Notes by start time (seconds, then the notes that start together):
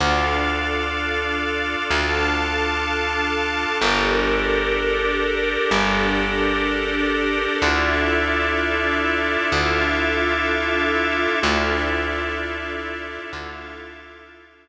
0.00 D2 D4 F4 A4 D5 F5
1.89 D2 A4 F5 A5
3.81 G1 D4 G4 A4 A#4 D5
5.71 G1 D4 G4 A4 D5
7.62 D2 D4 E4 F4 A4 D5 E5
9.51 D2 F4 A4 E5 F5
11.41 D2 D4 E4 F4 A4 D5 E5
13.33 D2 F4 A4 E5 F5